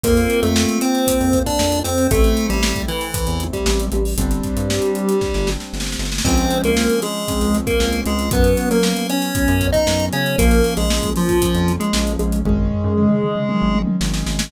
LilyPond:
<<
  \new Staff \with { instrumentName = "Lead 1 (square)" } { \time 4/4 \key c \major \tempo 4 = 116 <bes bes'>8. <a a'>8. <c' c''>4~ <c' c''>16 <d' d''>8. <c' c''>8 | <a a'>8. <g g'>8. <e e'>4~ <e e'>16 <g g'>8. <g g'>8 | <g g'>2. r4 | \key des \major <c' c''>8. <bes bes'>8. <aes aes'>4~ <aes aes'>16 <bes bes'>8. <aes aes'>8 |
<ces' ces''>8. <bes bes'>8. <des' des''>4~ <des' des''>16 <ees' ees''>8. <des' des''>8 | <bes bes'>8. <aes aes'>8. <f f'>4~ <f f'>16 <aes aes'>8. <aes aes'>8 | <aes aes'>2. r4 | }
  \new Staff \with { instrumentName = "Acoustic Grand Piano" } { \time 4/4 \key c \major <bes c' f'>1 | <a c' e'>1 | <g c' d'>1 | \key des \major <f aes c' des'>4 <f aes c' des'>4 <f aes c' des'>4 <f aes c' des'>4 |
<ges ces' des'>4 <ges ces' des'>4 <ges ces' des'>4 <ges ces' des'>4 | <f bes des'>4 <f bes des'>4 <f bes des'>4 <f bes des'>4 | <ees aes des'>4 <ees aes des'>4 <ees aes des'>4 <ees aes des'>4 | }
  \new Staff \with { instrumentName = "Synth Bass 1" } { \clef bass \time 4/4 \key c \major f,8. f,4. f,8. f,8 f,8 | a,,8. a,,4. e,8. a,,8 a,,8 | g,,8. g,4. g,,8. g,,8 g,,8 | \key des \major des,8. des,4. des,8. des,8 des,8 |
ges,8. ges4. ges,8. ges,8 des8 | bes,,8. bes,,4. f,8. bes,,8 bes,,8 | aes,,8. ges,4. aes,,8. aes,,8 aes,,8 | }
  \new DrumStaff \with { instrumentName = "Drums" } \drummode { \time 4/4 <hh bd>16 hh16 hh16 hh16 sn16 hh16 hh16 hh16 <hh bd>16 hh16 <hh bd>16 <hh bd>16 sn16 hh16 hh16 hh16 | <hh bd>16 hh16 hh16 hh16 sn16 <hh bd>16 hh16 hh16 <hh bd>16 hh16 hh16 <hh bd>16 sn16 hh16 hh16 hho16 | <hh bd>16 hh16 <hh bd>16 hh16 sn16 hh16 hh16 hh16 <bd sn>16 sn16 sn16 sn16 sn32 sn32 sn32 sn32 sn32 sn32 sn32 sn32 | <cymc bd>16 hh16 hh16 hh16 sn16 hh16 hh8 <hh bd>16 hh16 hh16 <hh bd>16 sn16 hh16 hh16 hh16 |
<hh bd>16 hh16 hh16 hh16 sn16 hh16 hh16 hh16 <hh bd>16 hh16 <hh bd>16 <hh bd>16 sn16 hh16 hh16 hh16 | <hh bd>16 hh16 hh16 hh16 sn16 <hh bd>16 hh16 <hh bd>16 <hh bd>16 hh16 hh16 hh16 sn16 hh16 hh16 hh16 | <bd tomfh>16 tomfh16 tomfh16 tomfh16 toml16 toml16 toml16 toml16 tommh16 tommh16 tommh16 tommh16 sn16 sn16 sn16 sn16 | }
>>